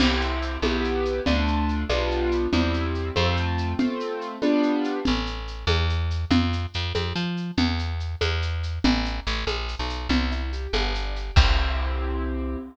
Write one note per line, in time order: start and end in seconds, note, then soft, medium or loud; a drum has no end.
0.00 0.58 C2 medium
0.00 0.57 C4 loud
0.00 0.57 E4 loud
0.00 0.57 G4 loud
0.00 crash loud
0.00 low conga loud
0.00 shaker medium
0.21 shaker medium
0.42 shaker medium
0.62 1.20 B1 medium
0.62 1.20 B3 loud
0.62 1.20 E4 loud
0.62 1.20 G4 loud
0.62 high conga medium
0.62 shaker medium
0.84 shaker medium
1.05 shaker medium
1.26 1.85 D2 medium
1.26 1.83 A3 loud
1.26 1.83 D4 loud
1.26 1.83 F4 loud
1.26 low conga medium
1.26 shaker medium
1.47 shaker medium
1.69 shaker medium
1.89 2.48 B1 medium
1.89 2.46 G3 loud
1.89 2.46 B3 medium
1.89 2.46 D4 loud
1.89 2.46 F4 loud
1.89 high conga medium
1.89 shaker medium
2.11 shaker medium
2.31 shaker medium
2.53 3.11 E2 medium
2.53 3.10 G3 loud
2.53 3.10 C4 loud
2.53 3.10 E4 loud
2.53 low conga medium
2.53 shaker medium
2.74 shaker medium
2.95 shaker medium
3.16 3.74 F2 medium
3.16 3.73 A3 loud
3.16 3.73 C4 loud
3.16 3.73 F4 loud
3.16 high conga medium
3.16 shaker medium
3.37 shaker medium
3.58 shaker medium
3.79 4.36 A3 loud
3.79 4.36 C4 loud
3.79 4.36 F4 medium
3.79 low conga loud
3.79 shaker medium
4.00 shaker medium
4.21 shaker medium
4.42 4.99 G3 loud
4.42 4.99 B3 loud
4.42 4.99 D4 loud
4.42 4.99 F4 loud
4.42 high conga medium
4.42 shaker medium
4.63 shaker medium
4.84 shaker medium
5.05 5.65 A1 medium
5.05 low conga medium
5.05 shaker medium
5.26 shaker medium
5.48 shaker medium
5.67 6.25 E2 medium
5.67 high conga medium
5.67 shaker medium
5.90 shaker medium
6.10 shaker medium
6.31 6.66 F2 medium
6.31 low conga loud
6.31 shaker medium
6.53 shaker medium
6.74 6.93 F2 medium
6.74 shaker medium
6.95 7.13 F2 medium
6.95 high conga medium
6.95 shaker medium
7.16 7.51 F3 medium
7.16 shaker medium
7.37 shaker medium
7.57 8.16 E2 medium
7.57 low conga medium
7.57 shaker medium
7.79 shaker medium
8.00 shaker medium
8.21 8.79 E2 medium
8.21 high conga medium
8.21 shaker medium
8.42 shaker medium
8.63 shaker medium
8.84 9.20 A1 medium
8.84 low conga loud
8.84 shaker medium
9.05 shaker medium
9.26 9.45 A1 medium
9.26 shaker medium
9.47 9.75 A#1 medium
9.47 high conga medium
9.47 shaker medium
9.69 shaker medium
9.79 10.08 B1 medium
9.90 shaker medium
10.09 10.67 C2 medium
10.09 10.30 C4 medium
10.09 low conga medium
10.09 shaker medium
10.31 10.50 E4 medium
10.31 shaker medium
10.53 10.72 G4 medium
10.53 shaker medium
10.73 11.31 G1 medium
10.73 10.93 B3 medium
10.73 high conga medium
10.73 shaker medium
10.95 11.14 D4 medium
10.95 shaker medium
11.16 11.35 G4 medium
11.16 shaker medium
11.36 12.56 C2 loud
11.36 12.57 C4 loud
11.36 12.57 E4 medium
11.36 12.57 G4 medium
11.36 kick loud
11.36 crash loud